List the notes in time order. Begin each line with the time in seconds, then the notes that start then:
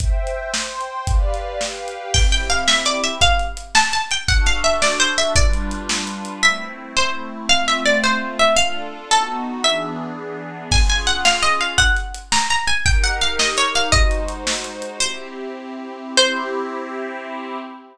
0.00 C5 E5 G5, kick, closed hi-hat
0.27 closed hi-hat
0.53 C5 G5 C6, snare
0.81 closed hi-hat
1.07 G4 B4 D5 F5, kick, closed hi-hat
1.34 closed hi-hat
1.60 G4 B4 F5 G5, snare
1.88 closed hi-hat
2.14 C4 E4 G4 G5, kick, crash
2.32 G5, closed hi-hat
2.50 F5, closed hi-hat
2.68 E5, snare
2.85 D5, closed hi-hat
3.04 E5, closed hi-hat
3.21 F5, kick, closed hi-hat
3.39 closed hi-hat
3.57 closed hi-hat
3.75 A5, snare
3.93 A5, closed hi-hat
4.11 G5, closed hi-hat
4.28 D4 F#4 A4 F#5, kick, closed hi-hat
4.46 F5, closed hi-hat
4.64 E5, closed hi-hat
4.82 D5, snare
5.00 C5, closed hi-hat
5.18 E5, closed hi-hat
5.35 G3 D4 F4 B4 D5, kick, closed hi-hat
5.53 closed hi-hat
5.71 closed hi-hat
5.89 snare
6.07 closed hi-hat
6.25 closed hi-hat
6.43 A3 C4 E4 E5
6.97 C5
7.49 A3 C4 F4 F5
7.68 E5
7.86 D5
8.04 C5
8.39 E5
8.56 D4 F4 A4 F5
9.11 B3 D#4 F#4 A4
9.64 E3 B3 D4 G#4 E5
10.71 C#4 F4 G#4 G#5, kick, crash
10.89 G#5, closed hi-hat
11.07 F#5, closed hi-hat
11.25 F5, snare
11.43 D#5, closed hi-hat
11.61 F5, closed hi-hat
11.78 F#5, kick, closed hi-hat
11.97 closed hi-hat
12.14 closed hi-hat
12.32 A#5, snare
12.50 A#5, closed hi-hat
12.67 G#5, closed hi-hat
12.86 D#4 G4 A#4 G5, kick, closed hi-hat
13.04 F#5, closed hi-hat
13.21 F5, closed hi-hat
13.39 D#5, snare
13.57 C#5, closed hi-hat
13.75 F5, closed hi-hat
13.92 G#3 D#4 F#4 C5 D#5, kick, closed hi-hat
14.11 closed hi-hat
14.28 closed hi-hat
14.47 snare
14.64 closed hi-hat
14.82 closed hi-hat
15.00 C4 E4 G4 C5
16.17 C4 E4 G4 C5